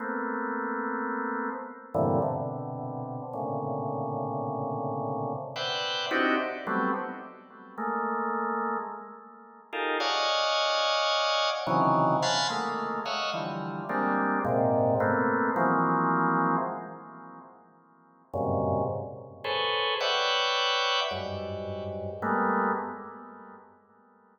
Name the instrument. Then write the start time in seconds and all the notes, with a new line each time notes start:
drawbar organ
0.00 A3 A#3 B3 C4
1.94 G2 A2 A#2 C3 D3 E3
2.22 B2 C3 D3
3.33 A2 A#2 C3 C#3 D3
5.56 B4 C5 D5 E5 F#5 G5
6.11 C4 D4 D#4 E4 F#4 G4
6.67 F#3 G3 A3 B3 C4
7.78 G#3 A3 A#3
9.73 D#4 F4 G4 G#4 A4 A#4
10.00 C#5 D5 D#5 F5 F#5 G#5
11.67 C3 C#3 D#3 E3 F#3
12.22 F5 F#5 G#5 A5 B5 C6
12.50 G#3 A3 A#3
13.06 C#5 D#5 E5 F5 F#5
13.34 D3 E3 F3 G3
13.89 G3 G#3 A#3 C4 D4
14.45 G#2 A#2 C3
15.00 A3 A#3 B3 C4
15.56 E3 F3 F#3 G#3 A#3 C4
18.34 F#2 G2 G#2 A#2 C3 C#3
19.44 G#4 A4 B4 C5 C#5
20.00 B4 C#5 D5 E5 F#5 G5
21.11 F#2 G2 G#2
22.22 G3 G#3 A3 A#3 B3